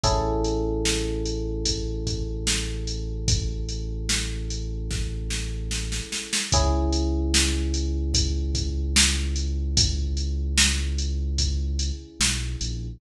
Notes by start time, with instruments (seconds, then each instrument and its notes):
0.04 synth bass 2 A1, electric piano 1 C#4 E4 G#4 A4, kick, closed hi-hat
0.44 closed hi-hat
0.85 snare
1.26 closed hi-hat
1.66 kick, closed hi-hat
2.07 kick, closed hi-hat
2.47 snare
2.87 closed hi-hat
3.28 kick, closed hi-hat
3.69 closed hi-hat
4.09 snare
4.51 closed hi-hat
4.91 kick, snare
5.30 snare
5.71 snare
5.92 snare
6.12 snare
6.33 snare
6.52 synth bass 2 C#2, electric piano 1 C#4 E4 G#4, kick, closed hi-hat
6.93 closed hi-hat
7.34 snare
7.74 closed hi-hat
8.14 kick, closed hi-hat
8.55 kick, closed hi-hat
8.96 snare
9.36 closed hi-hat
9.77 kick, closed hi-hat
10.17 closed hi-hat
10.58 snare
10.98 closed hi-hat
11.38 kick, closed hi-hat
11.79 closed hi-hat
12.20 synth bass 2 B1, snare
12.61 synth bass 2 A#1, closed hi-hat